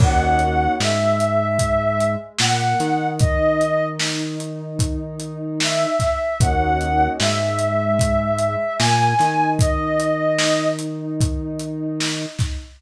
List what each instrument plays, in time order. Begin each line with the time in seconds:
0.00 synth bass 1 D#2, pad 2 (warm) A#3 C#4 D#4 F#4, ocarina F#5, kick, crash
0.39 closed hi-hat
0.80 synth bass 1 G#2, pad 2 (warm) G#3, ocarina E5, snare
1.20 closed hi-hat
1.59 kick, closed hi-hat
2.01 closed hi-hat
2.39 synth bass 1 A#2, pad 2 (warm) A#3, ocarina F#5, snare
2.80 synth bass 1 D#3, pad 2 (warm) D#4, snare, closed hi-hat
3.20 ocarina D#5, kick, closed hi-hat
3.61 closed hi-hat
4.00 snare
4.40 closed hi-hat
4.79 kick, closed hi-hat
5.20 closed hi-hat
5.60 ocarina E5, snare
6.00 kick, snare, closed hi-hat
6.40 synth bass 1 D#2, pad 2 (warm) A#3 C#4 D#4 F#4, ocarina F#5, kick, closed hi-hat
6.81 closed hi-hat
7.20 synth bass 1 G#2, pad 2 (warm) G#3, ocarina E5, snare
7.59 closed hi-hat
7.99 kick, closed hi-hat
8.38 closed hi-hat
8.79 synth bass 1 A#2, pad 2 (warm) A#3, ocarina G#5, snare
9.19 synth bass 1 D#3, pad 2 (warm) D#4, snare, closed hi-hat
9.59 ocarina D#5, kick, closed hi-hat
10.00 closed hi-hat
10.38 snare
10.79 closed hi-hat
11.21 kick, closed hi-hat
11.60 closed hi-hat
12.00 snare
12.39 kick, snare, closed hi-hat